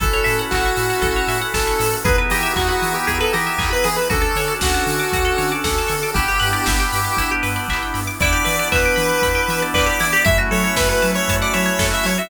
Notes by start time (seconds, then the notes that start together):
0.00 A1 C#4 E4 F#4 A4, kick, closed hi-hat
0.13 C#5
0.24 A2 E5, open hi-hat
0.39 F#5
0.51 A1 F#4 A5, kick, clap
0.65 C#6
0.77 A2 E6, open hi-hat
0.90 F#6
1.02 A1 A4, kick, closed hi-hat
1.16 C#5
1.28 A2 E5, open hi-hat
1.42 F#5
1.54 A1 A4 A5, kick, snare
1.67 C#6
1.79 A2 E6, snare, open hi-hat
1.93 F#6
2.04 E2 B3 D#4 E4 G#4 B4, kick, closed hi-hat
2.18 B4
2.30 E3 G4 D#5, open hi-hat
2.43 E5
2.56 E2 F#4 G#5, kick, clap
2.68 F#4 B5
2.82 E3 D#6, open hi-hat
2.94 G4 E6
3.07 E2 G#4, kick, closed hi-hat
3.20 A4 B4
3.33 E3 G4 D#5, open hi-hat
3.47 E5
3.58 E2 G#5, kick, clap
3.71 B4 B5
3.84 E3 G#4 D#6, snare, open hi-hat
3.96 B4 E6
4.10 D2 C#4 D4 F#4 A4, kick, closed hi-hat
4.22 A4
4.35 D3 C#5, open hi-hat
4.48 D5
4.61 D2 F#4 F#5, kick, snare
4.74 A5
4.87 D3 C#6, open hi-hat
4.99 D6
5.13 D2 F#4, kick, closed hi-hat
5.25 A4
5.38 D3 C#5, open hi-hat
5.52 D5
5.64 D2 A4 F#5, kick, snare
5.78 A5
5.88 D3 C#6, snare, open hi-hat
6.03 D6
6.14 G1 B3 D4 E4 G4, kick, closed hi-hat
6.28 G4
6.40 G2 B4, open hi-hat
6.53 D5
6.66 G1 E5, kick, snare
6.80 G5
6.92 G2 B5, open hi-hat
7.05 D6
7.17 G1 E4, kick, closed hi-hat
7.31 G4
7.43 G2 B4, open hi-hat
7.56 D5
7.68 G1 E5, kick, clap
7.83 G5
7.94 G2 B5, snare, open hi-hat
8.07 D6
8.20 E2 B3 D4 E4 G4 D5, kick, closed hi-hat
8.32 G4
8.45 E3 B4, open hi-hat
8.59 D5
8.72 E2 B4 E5, kick, clap
8.85 G5
8.96 E3 B5, open hi-hat
9.10 D6
9.22 E2 B5, kick, closed hi-hat
9.35 G5
9.48 E3 E5, open hi-hat
9.62 D5
9.74 E2 B4 D5, kick, clap
9.86 G4
10.00 E3 E4, snare, open hi-hat
10.13 G4
10.25 F#2 A3 C#4 E4 F#4 E5, kick, closed hi-hat
10.38 F#4
10.51 F#3 A4 C#5, open hi-hat
10.64 C#5
10.76 F#2 B4 E5, kick, snare
10.89 B4 F#5
11.02 F#3 A5, open hi-hat
11.14 C#5 C#6
11.28 F#2 A5, kick, closed hi-hat
11.42 D5 F#5
11.53 F#3 C#5 E5, open hi-hat
11.66 C#5
11.79 F#2 A4, kick, snare
11.91 F#4 E5
12.04 F#3 E4 C#5, snare, open hi-hat
12.18 F#4 E5